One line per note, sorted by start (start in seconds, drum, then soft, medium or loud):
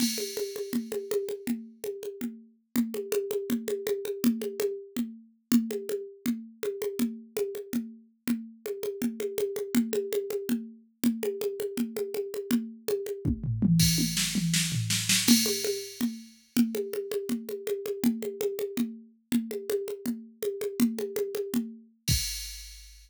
0.00 crash loud
0.00 low conga loud
0.18 high conga medium
0.37 high conga medium
0.56 high conga medium
0.73 low conga medium
0.92 high conga medium
1.11 high conga loud
1.29 high conga medium
1.47 low conga medium
1.84 high conga medium
2.03 high conga medium
2.21 low conga medium
2.76 low conga loud
2.94 high conga medium
3.12 high conga loud
3.31 high conga medium
3.50 low conga loud
3.68 high conga medium
3.87 high conga loud
4.05 high conga medium
4.24 low conga loud
4.42 high conga medium
4.60 high conga loud
4.96 low conga medium
5.52 low conga loud
5.71 high conga medium
5.89 high conga medium
6.26 low conga loud
6.63 high conga medium
6.82 high conga medium
6.99 low conga loud
7.37 high conga loud
7.55 high conga medium
7.73 low conga medium
8.28 low conga loud
8.66 high conga medium
8.83 high conga medium
9.02 low conga loud
9.20 high conga medium
9.38 high conga loud
9.56 high conga medium
9.75 low conga loud
9.93 high conga loud
10.13 high conga loud
10.30 high conga medium
10.49 low conga loud
11.04 low conga loud
11.23 high conga loud
11.41 high conga medium
11.60 high conga medium
11.77 low conga loud
11.97 high conga medium
12.14 high conga medium
12.34 high conga medium
12.51 low conga loud
12.88 high conga loud
13.06 high conga medium
13.25 kick loud
13.25 high tom medium
13.44 floor tom loud
13.62 mid tom loud
13.80 kick medium
13.80 crash loud
13.98 high tom medium
14.17 snare loud
14.35 mid tom loud
14.54 snare loud
14.72 floor tom loud
14.90 snare loud
15.09 snare loud
15.28 crash loud
15.28 low conga loud
15.46 high conga medium
15.64 high conga medium
16.01 low conga loud
16.57 low conga loud
16.75 high conga medium
16.93 high conga medium
17.12 high conga medium
17.29 low conga medium
17.49 high conga medium
17.67 high conga medium
17.86 high conga medium
18.04 low conga loud
18.22 high conga medium
18.41 high conga loud
18.59 high conga medium
18.77 low conga loud
19.32 low conga loud
19.51 high conga medium
19.70 high conga loud
19.88 high conga medium
20.06 low conga medium
20.43 high conga medium
20.61 high conga medium
20.80 low conga loud
20.99 high conga medium
21.16 high conga loud
21.35 high conga medium
21.54 low conga loud
22.08 kick loud
22.08 crash loud